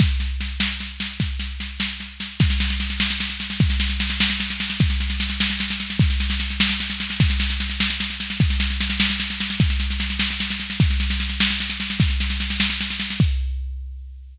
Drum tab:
CC |------------|------------|------------|------------|
SD |o-o-o-o-o-o-|o-o-o-o-o-o-|oooooooooooo|oooooooooooo|
BD |o-----------|o-----------|o-----------|o-----------|

CC |------------|------------|------------|------------|
SD |oooooooooooo|oooooooooooo|oooooooooooo|oooooooooooo|
BD |o-----------|o-----------|o-----------|o-----------|

CC |------------|------------|------------|x-----------|
SD |oooooooooooo|oooooooooooo|oooooooooooo|------------|
BD |o-----------|o-----------|o-----------|o-----------|